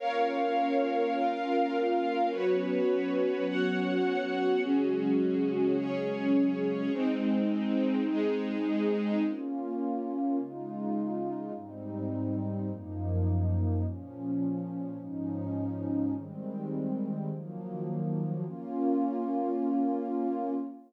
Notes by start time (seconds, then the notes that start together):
0.00 A#3 C#4 F4 A#4 C#5 F5
1.15 F4 A#4 F5
2.30 F#3 B3 C#4 F#4 B4 C#5
3.47 F#4 C#5 F#5
4.62 C#3 F#3 G#3 C#4 F#4 G#4
5.76 C#4 G#4 C#5
6.93 G#3 C4 D#4
8.08 G#3 D#4 G#4
9.24 A#3 C#4 F4
10.38 C#3 G#3 D#4 F4
11.56 G#2 G3 C4 D#4
12.69 F#2 F3 A#3 D#4
13.84 A#2 F3 C#4
14.99 G#2 F3 C#4 D#4
16.14 D#3 G3 G#3 C4
17.30 D#3 F3 F#3 A#3
18.45 A#3 C#4 F4